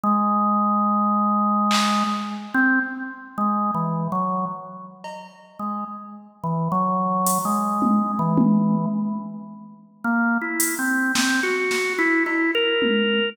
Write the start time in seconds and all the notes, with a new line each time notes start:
0.03 G#3
1.71 clap
2.54 C4
3.38 G#3
3.74 E3
4.12 F#3
5.04 cowbell
5.59 G#3
6.44 E3
6.72 F#3
7.26 closed hi-hat
7.45 G#3
7.82 high tom
8.19 E3
8.37 high tom
10.04 A#3
10.41 E4
10.60 closed hi-hat
10.79 C4
11.15 C4, snare
11.43 F#4
11.71 snare
11.98 E4
12.26 E4, cowbell
12.55 A#4
12.82 high tom